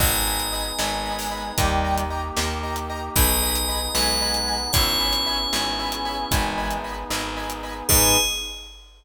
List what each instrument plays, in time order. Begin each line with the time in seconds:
0.00 electric bass (finger) G#1, brass section B3 D#4 G#4, acoustic grand piano D#5 G#5 B5, tubular bells D#5, kick, crash
0.26 acoustic grand piano D#5 G#5 B5
0.40 closed hi-hat
0.53 acoustic grand piano D#5 G#5 B5
0.78 electric bass (finger) G#1, choir aahs G#3, acoustic grand piano D#5 G#5 B5, snare
1.05 acoustic grand piano D#5 G#5 B5
1.19 open hi-hat
1.31 acoustic grand piano D#5 G#5 B5
1.57 electric bass (finger) D#2, choir aahs D#3 G3, brass section A#3 D#4 G4, acoustic grand piano D#5 G5 A#5, kick, closed hi-hat
1.84 acoustic grand piano D#5 G5 A#5
1.98 closed hi-hat
2.10 acoustic grand piano D#5 G5 A#5
2.37 electric bass (finger) D#2, acoustic grand piano D#5 G5 A#5, snare
2.63 acoustic grand piano D#5 G5 A#5
2.76 closed hi-hat
2.90 acoustic grand piano D#5 G5 A#5
3.15 electric bass (finger) B1, brass section B3 D#4 G#4, tubular bells D#5, acoustic grand piano D#5 G#5 B5, kick, closed hi-hat
3.42 acoustic grand piano D#5 G#5 B5
3.55 closed hi-hat
3.68 acoustic grand piano D#5 G#5 B5
3.95 electric bass (finger) B1, choir aahs G#3, acoustic grand piano D#5 G#5 B5, tubular bells F#5, snare
4.21 acoustic grand piano D#5 G#5 B5
4.34 closed hi-hat
4.47 acoustic grand piano D#5 G#5 B5
4.73 electric bass (finger) G#1, brass section B3 C#4 E4 G#4, tubular bells C#5, acoustic grand piano C#5 E5 G#5 B5, kick, closed hi-hat
5.00 acoustic grand piano C#5 E5 G#5 B5
5.13 closed hi-hat
5.26 acoustic grand piano C#5 E5 G#5 B5
5.53 electric bass (finger) G#1, choir aahs G#4, acoustic grand piano C#5 E5 G#5 B5, snare
5.79 acoustic grand piano C#5 E5 G#5 B5
5.92 closed hi-hat
6.05 acoustic grand piano C#5 E5 G#5 B5
6.30 electric bass (finger) G#1, choir aahs E3 G#3, brass section B3 D#4 G#4, acoustic grand piano D#5 G#5 B5, kick, closed hi-hat
6.58 acoustic grand piano D#5 G#5 B5
6.71 closed hi-hat
6.84 acoustic grand piano D#5 G#5 B5
7.10 electric bass (finger) G#1, acoustic grand piano D#5 G#5 B5, snare
7.37 acoustic grand piano D#5 G#5 B5
7.50 closed hi-hat
7.63 acoustic grand piano D#5 G#5 B5
7.88 electric bass (finger) G#2, choir aahs G#3, brass section B3 D#4 G#4, acoustic grand piano D#4 G#4 B4, tubular bells G#4, kick, crash